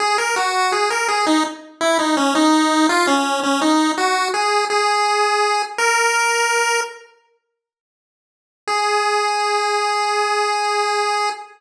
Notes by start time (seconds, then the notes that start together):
0.00 G#4
0.18 A#4
0.36 F#4
0.72 G#4
0.90 A#4
1.08 G#4
1.27 D#4
1.81 E4
1.99 D#4
2.17 C#4
2.35 D#4
2.89 F4
3.07 C#4
3.43 C#4
3.61 D#4
3.98 F#4
4.34 G#4
4.70 G#4
5.78 A#4
8.67 G#4